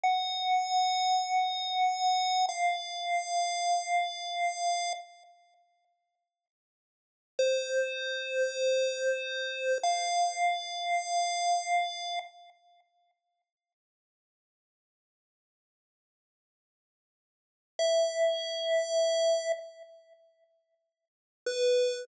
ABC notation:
X:1
M:4/4
L:1/8
Q:1/4=98
K:F#m
V:1 name="Lead 1 (square)"
f8 | [K:Fm] f8 | z8 | c8 |
f8 | [K:F#m] z8 | z8 | z2 e6 |
z6 B2 |]